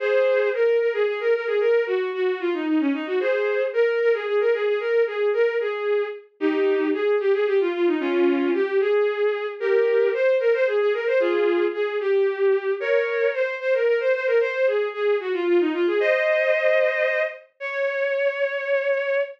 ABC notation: X:1
M:6/8
L:1/16
Q:3/8=75
K:Db
V:1 name="Violin"
[Ac]4 B2 B A A B B A | B2 G2 G2 F E E D E G | [Ac]4 B2 B A A B A A | B2 A2 B2 A4 z2 |
[K:Ab] [EG]4 A2 G A G F F E | [DF]4 G2 A6 | [GB]4 c2 B c A A B c | [FA]4 A2 G6 |
[K:Db] [Bd]4 c2 c B B c c B | c2 A2 A2 G F F E F A | [ce]10 z2 | d12 |]